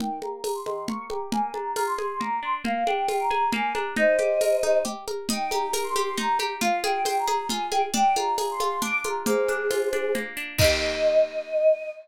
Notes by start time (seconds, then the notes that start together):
0.00 D#3 G5, low conga
0.22 A#3 A#5, high conga
0.44 G4 A#5, tambourine, high conga
0.54 C6
0.65 D#3 C6, high conga
0.87 A#3 C#6, low conga
1.10 G4 A#5, high conga
1.32 A#3 G#5, low conga
1.53 D4 A#5, high conga
1.76 F4 A#5, tambourine, high conga
1.87 C6
1.98 G#4 C6, high conga
2.20 A#3 A#5, low conga
2.43 D4 C6
2.64 A#3 F5, low conga
2.86 D4 G5, high conga
3.08 F4 G5, tambourine, high conga
3.20 A#5
3.31 G#4 A#5, high conga
3.52 A#3 G#5, low conga
3.73 D4 A#5, high conga
3.96 D#4 C5 D#5, low conga
4.19 G4, high conga
4.41 A#4, tambourine, high conga
4.63 D#4, high conga
4.85 G4, low conga
5.08 A#4, high conga
5.29 D#4 G5, low conga
5.50 G4 A#5, high conga
5.73 A#4 A#5, tambourine, high conga
5.83 C6
5.96 G4 C6, high conga
6.17 D#4 A#5, low conga
6.39 G4 A#5, high conga
6.61 F4 F5, low conga
6.83 G#4 G5, high conga
7.05 C5 G5, tambourine, high conga
7.18 A#5
7.27 G#4 A#5, high conga
7.49 F4 G#5, low conga
7.71 G#4 G5, high conga
7.94 D4 G5, low conga
8.16 F4 A#5, high conga
8.38 G#4 A#5, tambourine, high conga
8.51 C6
8.60 F4 C6, high conga
8.82 D4 D6, low conga
9.04 F4 A#5, high conga
9.25 A#3 G#4 C5, low conga
9.48 D4, high conga
9.71 F4, tambourine, high conga
9.93 D4, high conga
10.15 A#3, low conga
10.37 D4
10.58 D#3 A#3 D#5, kick, crash
10.64 G4